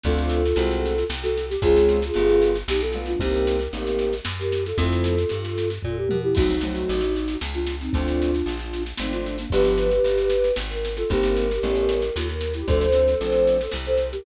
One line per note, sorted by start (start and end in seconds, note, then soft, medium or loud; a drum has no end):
0.04 0.53 D2 loud
0.04 0.42 A3 medium
0.04 0.42 C4 medium
0.04 0.42 D4 medium
0.04 0.42 F4 medium
0.04 1.04 F4 medium
0.04 1.04 A4 loud
0.04 kick loud
0.04 snare medium
0.18 snare medium
0.29 snare loud
0.46 snare medium
0.56 1.04 C2 loud
0.56 0.94 G#3 medium
0.56 0.94 A3 medium
0.56 0.94 C4 medium
0.56 0.94 F#4 medium
0.56 snare loud
0.71 snare medium
0.85 snare medium
0.98 snare medium
1.10 1.57 C2 loud
1.10 snare loud
1.22 1.46 F#4 medium
1.22 1.46 A4 medium
1.22 snare medium
1.37 snare medium
1.50 1.62 G4 loud
1.50 snare medium
1.62 2.11 C#2 loud
1.62 1.99 G#3 loud
1.62 1.99 C4 medium
1.62 1.99 C#4 medium
1.62 1.99 F4 medium
1.62 2.57 F4 loud
1.62 2.57 G#4 loud
1.62 kick loud
1.62 snare loud
1.76 snare medium
1.88 snare medium
2.02 snare loud
2.14 2.63 G1 loud
2.14 2.52 G3 medium
2.14 2.52 A3 medium
2.14 2.52 B3 medium
2.14 2.52 F4 medium
2.14 snare medium
2.29 snare medium
2.42 snare loud
2.55 snare medium
2.68 3.15 B1 loud
2.68 2.81 D#4 medium
2.68 2.81 G4 medium
2.68 snare loud
2.80 3.05 F4 medium
2.80 3.05 A4 medium
2.80 snare loud
2.93 3.13 G3 medium
2.93 3.13 A3 medium
2.93 3.13 B3 medium
2.93 3.13 F4 medium
2.93 snare medium
3.06 3.20 D4 medium
3.06 3.20 F4 medium
3.06 snare medium
3.19 3.68 C2 loud
3.19 3.57 G3 medium
3.19 3.57 A#3 medium
3.19 3.57 C4 medium
3.19 3.57 D#4 medium
3.19 4.14 G4 medium
3.19 4.14 A#4 medium
3.19 kick loud
3.19 snare loud
3.34 snare medium
3.47 snare loud
3.59 snare medium
3.73 4.21 A1 medium
3.73 4.10 G3 medium
3.73 4.10 A#3 medium
3.73 4.10 C4 medium
3.73 4.10 D#4 medium
3.73 snare medium
3.87 snare medium
3.99 snare medium
4.13 snare medium
4.25 4.73 F#2 medium
4.25 snare loud
4.39 4.64 G4 medium
4.39 4.64 A#4 medium
4.39 snare medium
4.52 snare loud
4.65 4.77 F4 medium
4.65 4.77 A4 medium
4.65 snare medium
4.78 5.25 F2 loud
4.78 5.15 F3 medium
4.78 5.15 A3 medium
4.78 5.15 C4 medium
4.78 5.15 E4 medium
4.78 5.69 F4 medium
4.78 5.69 A4 medium
4.78 kick loud
4.78 snare loud
4.92 snare medium
5.04 snare loud
5.18 snare medium
5.29 5.79 G2 medium
5.29 snare loud
5.45 snare medium
5.58 snare loud
5.70 snare medium
5.82 6.08 A#2 medium
5.82 5.96 F4 medium
5.82 5.96 A4 medium
5.82 kick loud
5.82 floor tom medium
5.97 6.18 G4 medium
5.97 6.18 A#4 medium
6.09 6.34 B2 medium
6.09 high tom loud
6.23 6.35 E4 medium
6.23 6.35 G4 medium
6.35 6.85 C2 loud
6.35 6.54 F#3 medium
6.35 6.54 A3 medium
6.35 6.54 C4 medium
6.35 6.54 D#4 medium
6.35 7.36 D#4 medium
6.35 7.36 F#4 loud
6.35 kick loud
6.35 snare loud
6.35 crash loud
6.50 snare medium
6.61 7.00 F#3 medium
6.61 7.00 A3 medium
6.61 7.00 C4 medium
6.61 7.00 D#4 medium
6.61 snare loud
6.75 snare medium
6.89 7.37 A1 loud
6.89 snare loud
7.00 snare medium
7.16 snare medium
7.28 snare loud
7.41 7.89 C#2 loud
7.41 snare loud
7.54 7.76 D4 medium
7.54 7.76 F4 medium
7.54 snare medium
7.67 snare loud
7.81 7.93 C4 medium
7.81 7.93 D#4 medium
7.81 snare medium
7.93 8.42 D2 loud
7.93 8.31 F3 medium
7.93 8.31 A3 medium
7.93 8.31 C4 medium
7.93 8.83 D4 medium
7.93 8.31 D4 medium
7.93 8.83 F4 loud
7.93 kick loud
7.93 snare medium
8.08 snare medium
8.22 snare medium
8.34 snare medium
8.46 8.93 A#1 loud
8.46 snare medium
8.59 snare medium
8.73 snare medium
8.86 snare medium
8.97 9.46 G#1 medium
8.97 9.36 F3 medium
8.97 9.36 A3 medium
8.97 9.12 C4 medium
8.97 9.36 C4 medium
8.97 9.36 D4 medium
8.97 9.12 D#4 medium
8.97 snare loud
9.12 9.36 D4 medium
9.12 9.36 F4 medium
9.12 snare medium
9.26 snare medium
9.38 9.51 A#3 medium
9.38 9.51 D4 medium
9.38 snare medium
9.50 10.00 G1 loud
9.50 9.89 F3 medium
9.50 9.89 G3 medium
9.50 9.89 B3 loud
9.50 9.89 D4 medium
9.50 10.52 G4 loud
9.50 10.52 B4 loud
9.50 kick loud
9.50 snare loud
9.64 snare medium
9.78 snare medium
9.91 snare medium
10.04 10.52 G1 medium
10.04 snare medium
10.18 snare medium
10.30 snare loud
10.44 snare medium
10.56 11.04 G#1 loud
10.56 snare loud
10.70 10.93 A#4 medium
10.70 snare medium
10.85 snare loud
10.97 11.09 F4 medium
10.97 11.09 A4 medium
10.97 snare medium
11.10 11.59 G1 loud
11.10 11.47 G3 medium
11.10 11.47 A#3 medium
11.10 11.47 C4 medium
11.10 11.47 D#4 medium
11.10 12.12 G4 medium
11.10 12.12 A#4 loud
11.10 kick loud
11.10 snare medium
11.23 snare loud
11.37 snare loud
11.51 snare medium
11.63 12.11 A1 loud
11.63 12.00 G3 medium
11.63 12.00 A3 medium
11.63 12.00 B3 medium
11.63 12.00 C#4 medium
11.63 snare loud
11.75 snare medium
11.89 snare loud
12.02 snare medium
12.15 12.63 D#2 loud
12.15 12.27 F4 medium
12.15 12.27 A4 medium
12.15 snare loud
12.28 12.50 A#4 medium
12.28 snare medium
12.41 snare loud
12.54 12.67 E4 medium
12.54 12.67 G4 medium
12.54 snare medium
12.68 13.15 D2 loud
12.68 12.86 F3 medium
12.68 12.86 A3 medium
12.68 12.86 C4 medium
12.68 12.86 D4 medium
12.68 13.70 A4 loud
12.68 13.70 C5 loud
12.68 kick loud
12.68 snare medium
12.81 snare medium
12.92 13.13 F3 medium
12.92 13.13 A3 medium
12.92 13.13 C4 medium
12.92 13.13 D4 medium
12.92 snare loud
13.08 snare medium
13.21 13.68 A#1 medium
13.21 13.57 F3 medium
13.21 13.57 A3 medium
13.21 13.57 C4 medium
13.21 13.57 D4 medium
13.21 snare medium
13.32 snare medium
13.47 snare medium
13.61 snare medium
13.71 14.21 C2 medium
13.71 snare loud
13.85 14.08 A4 medium
13.85 14.08 C5 medium
13.85 snare medium
13.97 snare medium
14.12 14.24 G4 medium
14.12 14.24 A#4 medium
14.12 snare medium